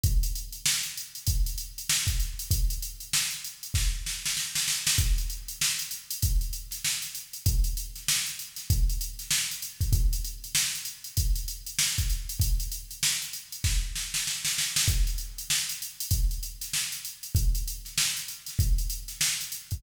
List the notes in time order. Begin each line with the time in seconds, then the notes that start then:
0.03 kick, closed hi-hat
0.23 closed hi-hat
0.35 closed hi-hat
0.52 closed hi-hat
0.66 snare
0.83 closed hi-hat
0.97 closed hi-hat
1.15 closed hi-hat
1.27 kick, closed hi-hat
1.46 closed hi-hat
1.58 closed hi-hat
1.78 closed hi-hat
1.89 snare
2.07 kick, closed hi-hat
2.20 snare, closed hi-hat
2.39 closed hi-hat
2.51 kick, closed hi-hat
2.70 closed hi-hat
2.82 closed hi-hat
3.00 closed hi-hat
3.13 snare
3.31 closed hi-hat
3.44 closed hi-hat
3.63 closed hi-hat
3.74 kick, snare
4.06 snare
4.26 snare
4.37 snare
4.55 snare
4.68 snare
4.87 snare
4.98 kick, closed hi-hat
5.18 closed hi-hat
5.30 closed hi-hat
5.48 closed hi-hat
5.61 snare
5.79 closed hi-hat
5.91 closed hi-hat
6.11 closed hi-hat
6.22 kick, closed hi-hat
6.41 closed hi-hat
6.53 closed hi-hat
6.71 snare, closed hi-hat
6.85 snare
7.02 snare, closed hi-hat
7.15 closed hi-hat
7.33 closed hi-hat
7.46 kick, closed hi-hat
7.64 closed hi-hat
7.77 closed hi-hat
7.95 snare, closed hi-hat
8.08 snare
8.26 closed hi-hat
8.39 closed hi-hat
8.56 snare, closed hi-hat
8.70 kick, closed hi-hat
8.89 closed hi-hat
9.01 closed hi-hat
9.19 snare, closed hi-hat
9.31 snare
9.51 closed hi-hat
9.62 closed hi-hat
9.81 kick, closed hi-hat
9.93 kick, closed hi-hat
10.13 closed hi-hat
10.24 closed hi-hat
10.44 closed hi-hat
10.55 snare
10.75 closed hi-hat
10.85 closed hi-hat
11.04 closed hi-hat
11.17 kick, closed hi-hat
11.36 closed hi-hat
11.48 closed hi-hat
11.66 closed hi-hat
11.79 snare
11.98 kick, closed hi-hat
12.09 snare, closed hi-hat
12.29 closed hi-hat
12.40 kick, closed hi-hat
12.60 closed hi-hat
12.72 closed hi-hat
12.91 closed hi-hat
13.03 snare
13.22 closed hi-hat
13.33 closed hi-hat
13.52 closed hi-hat
13.64 kick, snare
13.95 snare
14.14 snare
14.27 snare
14.45 snare
14.58 snare
14.76 snare
14.88 kick, closed hi-hat
15.07 closed hi-hat
15.18 closed hi-hat
15.38 closed hi-hat
15.50 snare
15.69 closed hi-hat
15.82 closed hi-hat
16.00 closed hi-hat
16.11 kick, closed hi-hat
16.31 closed hi-hat
16.43 closed hi-hat
16.61 snare, closed hi-hat
16.73 snare
16.92 snare, closed hi-hat
17.05 closed hi-hat
17.23 closed hi-hat
17.35 kick, closed hi-hat
17.55 closed hi-hat
17.68 closed hi-hat
17.85 snare, closed hi-hat
17.98 snare
18.17 closed hi-hat
18.28 closed hi-hat
18.46 snare, closed hi-hat
18.59 kick, closed hi-hat
18.78 closed hi-hat
18.90 closed hi-hat
19.08 snare, closed hi-hat
19.21 snare
19.41 closed hi-hat
19.52 closed hi-hat
19.71 kick, closed hi-hat